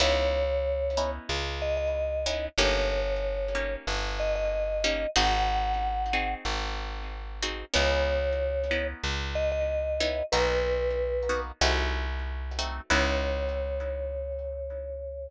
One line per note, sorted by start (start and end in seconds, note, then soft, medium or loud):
0.00 1.19 C#2 loud
0.00 0.45 B3 medium
0.00 0.45 C#4 medium
0.00 0.45 D#4 medium
0.00 0.45 E4 medium
0.00 1.10 C#5 loud
0.97 1.42 B3 medium
0.97 1.42 C#4 medium
0.97 1.42 D#4 medium
0.97 1.42 E4 medium
1.29 2.48 C#2 loud
1.62 1.76 D#5 loud
1.77 2.46 D#5 loud
2.26 2.49 B3 medium
2.26 2.49 C#4 medium
2.26 2.49 D#4 medium
2.26 2.49 E4 medium
2.58 3.76 G1 loud
2.58 3.03 A#3 medium
2.58 3.03 C#4 medium
2.58 3.03 D#4 medium
2.58 3.03 G4 medium
2.58 3.75 C#5 loud
3.55 4.00 A#3 medium
3.55 4.00 C#4 medium
3.55 4.00 D#4 medium
3.55 4.00 G4 medium
3.87 5.06 G1 medium
4.19 4.35 D#5 loud
4.35 5.10 D#5 loud
4.84 5.07 A#3 medium
4.84 5.07 C#4 medium
4.84 5.07 D#4 medium
4.84 5.07 G4 medium
5.16 6.35 G#1 loud
5.16 5.61 C4 medium
5.16 5.61 D#4 loud
5.16 5.61 F#4 medium
5.16 5.61 G#4 medium
5.16 6.34 F#5 loud
6.13 6.58 C4 medium
6.13 6.58 D#4 medium
6.13 6.58 F#4 medium
6.13 6.58 G#4 medium
6.45 7.64 G#1 medium
7.42 7.65 C4 medium
7.42 7.65 D#4 medium
7.42 7.65 F#4 medium
7.42 7.65 G#4 medium
7.74 8.94 C#2 loud
7.74 8.19 B3 loud
7.74 8.19 C#4 medium
7.74 8.19 D#4 loud
7.74 8.19 E4 medium
7.74 8.87 C#5 loud
8.71 9.16 B3 medium
8.71 9.16 C#4 medium
8.71 9.16 D#4 medium
8.71 9.16 E4 medium
9.03 10.22 C#2 medium
9.35 9.50 D#5 loud
9.52 10.25 D#5 loud
10.00 10.23 B3 medium
10.00 10.23 C#4 medium
10.00 10.23 D#4 medium
10.00 10.23 E4 medium
10.32 11.52 B1 loud
10.32 10.78 A#3 medium
10.32 10.78 B3 medium
10.32 10.78 D#4 medium
10.32 10.78 F#4 medium
10.32 11.40 B4 loud
11.29 11.52 A#3 medium
11.29 11.52 B3 medium
11.29 11.52 D#4 medium
11.29 11.52 F#4 medium
11.61 12.80 C2 loud
11.61 12.06 A3 medium
11.61 12.06 C4 medium
11.61 12.06 D#4 medium
11.61 12.06 F#4 loud
12.59 12.81 A3 medium
12.59 12.81 C4 medium
12.59 12.81 D#4 medium
12.59 12.81 F#4 medium
12.90 15.28 C#2 loud
12.90 15.27 B3 loud
12.90 15.27 C#4 loud
12.90 15.27 D#4 loud
12.90 15.27 E4 loud
12.90 15.28 C#5 loud